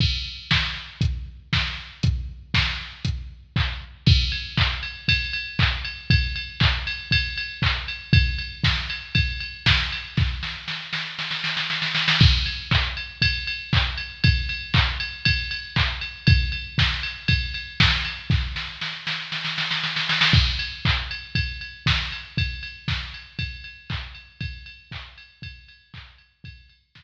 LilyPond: \new DrumStaff \drummode { \time 4/4 \tempo 4 = 118 <cymc bd>4 <bd sn>4 <hh bd>4 <bd sn>4 | <hh bd>4 <bd sn>4 <hh bd>4 <hc bd>4 | <cymc bd>8 cymr8 <hc bd>8 cymr8 <bd cymr>8 cymr8 <hc bd>8 cymr8 | <bd cymr>8 cymr8 <hc bd>8 cymr8 <bd cymr>8 cymr8 <hc bd>8 cymr8 |
<bd cymr>8 cymr8 <bd sn>8 cymr8 <bd cymr>8 cymr8 <bd sn>8 cymr8 | <bd sn>8 sn8 sn8 sn8 sn16 sn16 sn16 sn16 sn16 sn16 sn16 sn16 | <cymc bd>8 cymr8 <hc bd>8 cymr8 <bd cymr>8 cymr8 <hc bd>8 cymr8 | <bd cymr>8 cymr8 <hc bd>8 cymr8 <bd cymr>8 cymr8 <hc bd>8 cymr8 |
<bd cymr>8 cymr8 <bd sn>8 cymr8 <bd cymr>8 cymr8 <bd sn>8 cymr8 | <bd sn>8 sn8 sn8 sn8 sn16 sn16 sn16 sn16 sn16 sn16 sn16 sn16 | <cymc bd>8 cymr8 <hc bd>8 cymr8 <bd cymr>8 cymr8 <bd sn>8 cymr8 | <bd cymr>8 cymr8 <bd sn>8 cymr8 <bd cymr>8 cymr8 <hc bd>8 cymr8 |
<bd cymr>8 cymr8 <hc bd>8 cymr8 <bd cymr>8 cymr8 <hc bd>8 cymr8 | <bd cymr>8 cymr8 <bd sn>4 r4 r4 | }